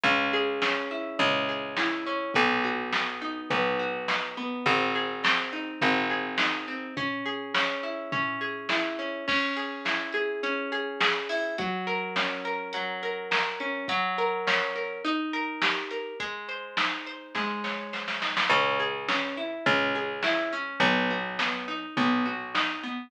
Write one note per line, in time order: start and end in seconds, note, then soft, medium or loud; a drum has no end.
0.03 1.10 C#2 medium
0.03 0.62 C#4 loud
0.03 kick medium
0.03 floor tom medium
0.33 1.48 G#4 medium
0.62 1.19 C#4 medium
0.62 snare medium
0.91 1.77 E4 medium
1.19 2.25 C#2 medium
1.19 2.06 C#4 medium
1.19 floor tom medium
1.49 2.31 G#4 medium
1.77 2.32 E4 medium
1.77 snare medium
2.06 2.34 C#4 medium
2.34 3.42 B1 medium
2.34 2.93 B3 loud
2.34 kick medium
2.34 floor tom medium
2.64 3.79 F#4 medium
2.93 3.50 B3 medium
2.93 snare medium
3.22 4.08 D#4 medium
3.50 4.56 B1 medium
3.50 4.37 B3 loud
3.50 floor tom medium
3.79 4.62 F#4 medium
4.08 4.63 D#4 medium
4.08 snare medium
4.37 4.65 B3 medium
4.66 5.72 G#1 medium
4.66 5.23 C4 loud
4.66 kick medium
4.66 floor tom medium
4.95 6.10 G#4 medium
5.24 5.81 C4 medium
5.24 snare loud
5.53 6.38 D#4 medium
5.81 6.88 G#1 medium
5.81 6.67 C4 medium
5.81 floor tom medium
6.10 6.92 G#4 medium
6.38 6.94 D#4 medium
6.38 snare medium
6.68 6.95 C4 medium
6.97 7.54 C#4 loud
6.97 kick medium
6.97 floor tom medium
7.25 8.40 G#4 medium
7.54 8.12 C#4 medium
7.54 snare medium
7.83 8.69 E4 medium
8.12 8.98 C#4 medium
8.12 floor tom medium
8.41 9.23 G#4 medium
8.69 9.25 E4 medium
8.69 snare medium
8.99 9.26 C#4 medium
9.28 10.43 C#4 loud
9.28 kick loud
9.28 crash medium
9.56 10.13 G#4 medium
9.56 closed hi-hat medium
9.85 11.29 E4 medium
9.85 snare medium
10.12 10.71 G#4 medium
10.12 closed hi-hat medium
10.43 11.53 C#4 medium
10.43 closed hi-hat medium
10.72 11.00 G#4 medium
10.72 closed hi-hat medium
11.00 11.55 G#4 medium
11.00 snare loud
11.29 11.57 E4 medium
11.29 open hi-hat medium
11.58 12.73 F#3 loud
11.58 kick loud
11.58 closed hi-hat medium
11.87 12.44 A#4 medium
11.87 closed hi-hat medium
12.16 13.60 C#4 medium
12.16 snare medium
12.45 13.02 A#4 medium
12.45 closed hi-hat medium
12.73 13.83 F#3 medium
12.73 closed hi-hat medium
13.03 13.31 A#4 medium
13.03 closed hi-hat medium
13.31 13.86 A#4 medium
13.31 snare medium
13.60 13.87 C#4 medium
13.60 closed hi-hat medium
13.88 14.99 F#3 loud
13.88 kick medium
13.88 closed hi-hat loud
14.18 14.75 A#4 medium
14.18 closed hi-hat medium
14.47 15.02 C#4 medium
14.47 snare medium
14.75 15.03 A#4 medium
14.75 closed hi-hat medium
15.04 16.14 D#4 loud
15.04 closed hi-hat medium
15.33 15.91 A#4 medium
15.33 closed hi-hat medium
15.62 16.17 G4 medium
15.62 snare medium
15.91 16.19 A#4 medium
15.91 closed hi-hat medium
16.20 17.35 G#3 medium
16.20 kick medium
16.20 closed hi-hat medium
16.49 17.06 C5 medium
16.49 closed hi-hat medium
16.77 18.21 D#4 medium
16.77 snare medium
17.06 17.92 C5 medium
17.06 closed hi-hat medium
17.35 18.45 G#3 medium
17.35 kick medium
17.35 snare medium
17.64 18.46 C#5 medium
17.64 snare medium
17.93 18.48 C5 medium
17.93 snare medium
18.08 snare medium
18.22 18.49 D#4 medium
18.22 snare medium
18.37 snare medium
18.50 19.56 C#2 medium
18.50 18.79 C#4 loud
18.50 kick medium
18.50 floor tom medium
18.79 19.08 G#4 medium
19.08 19.37 C#4 medium
19.08 snare medium
19.37 19.66 E4 medium
19.66 20.72 C#2 medium
19.66 19.95 C#4 medium
19.66 floor tom medium
19.95 20.24 G#4 medium
20.23 20.53 E4 medium
20.23 snare medium
20.53 20.80 C#4 medium
20.80 21.86 B1 medium
20.80 21.10 B3 loud
20.80 kick medium
20.80 floor tom medium
21.10 21.39 F#4 medium
21.39 21.68 B3 medium
21.39 snare medium
21.68 21.97 D#4 medium
21.97 23.03 B1 medium
21.97 22.26 B3 loud
21.97 floor tom medium
22.25 22.54 F#4 medium
22.54 22.83 D#4 medium
22.54 snare medium
22.83 23.11 B3 medium